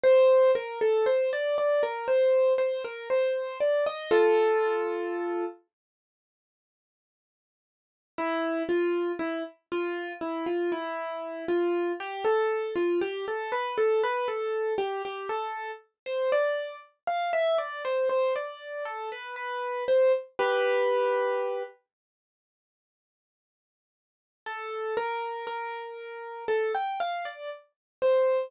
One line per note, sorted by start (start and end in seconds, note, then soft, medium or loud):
0.03 0.51 C5 loud
0.55 0.79 A#4 medium
0.81 1.05 A4 loud
1.06 1.30 C5 medium
1.33 1.57 D5 loud
1.58 1.82 D5 medium
1.83 2.07 A#4 medium
2.08 2.53 C5 medium
2.58 2.82 C5 medium
2.84 3.08 A#4 medium
3.10 3.58 C5 medium
3.60 3.85 D5 medium
3.86 4.10 D#5 loud
4.11 5.44 F4 loud
4.11 5.44 A4 loud
8.18 8.63 E4 loud
8.69 9.12 F4 medium
9.19 9.43 E4 medium
9.72 10.13 F4 loud
10.21 10.45 E4 medium
10.46 10.70 F4 medium
10.72 11.45 E4 medium
11.48 11.92 F4 medium
12.00 12.24 G4 loud
12.24 12.74 A4 loud
12.75 13.00 F4 medium
13.01 13.25 G4 loud
13.28 13.52 A4 medium
13.52 13.76 B4 medium
13.78 14.02 A4 medium
14.03 14.28 B4 loud
14.28 14.74 A4 medium
14.78 15.02 G4 loud
15.05 15.29 G4 medium
15.29 15.71 A4 loud
16.06 16.30 C5 medium
16.32 16.76 D5 loud
17.07 17.31 F5 loud
17.33 17.57 E5 loud
17.58 17.82 D5 medium
17.85 18.09 C5 medium
18.09 18.33 C5 medium
18.36 18.83 D5 medium
18.85 19.09 A4 medium
19.12 19.36 B4 medium
19.36 19.84 B4 medium
19.88 20.12 C5 medium
20.39 21.63 G4 loud
20.39 21.63 B4 loud
24.46 24.94 A4 loud
24.97 25.46 A#4 loud
25.47 26.44 A#4 medium
26.48 26.72 A4 loud
26.75 26.99 G5 medium
27.00 27.24 F5 loud
27.25 27.49 D5 medium
28.02 28.49 C5 medium